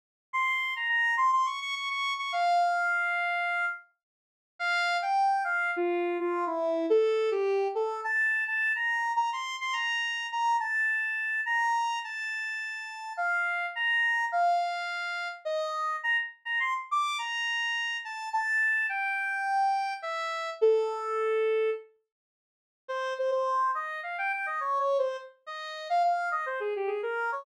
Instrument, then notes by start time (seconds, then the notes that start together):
lead 1 (square)
0.33 C6
0.76 A#5
0.89 A#5
1.17 C6
1.32 C6
1.46 C#6
1.61 C#6
1.75 C#6
1.90 C#6
2.18 C#6
2.32 F5
4.59 F5
5.02 G5
5.44 F5
5.76 F4
6.20 F4
6.47 E4
6.90 A4
7.31 G4
7.75 A4
8.04 A5
8.47 A5
8.75 A#5
9.16 A#5
9.33 C6
9.61 C6
9.73 A#5
10.32 A#5
10.60 A5
11.46 A#5
12.04 A5
13.17 F5
13.75 A#5
14.32 F5
15.45 D#5
16.03 A#5
16.45 A#5
16.60 C6
16.91 D6
17.18 A#5
18.05 A5
18.33 A5
18.89 G5
20.02 E5
20.61 A4
22.88 C5
23.18 C5
23.31 C5
23.75 D#5
24.03 F5
24.18 G5
24.32 G5
24.46 D#5
24.60 C#5
24.79 C#5
24.98 C5
25.46 D#5
25.90 F5
26.03 F5
26.31 D#5
26.46 C5
26.60 G#4
26.76 G4
26.87 G#4
27.03 A#4
27.32 C#5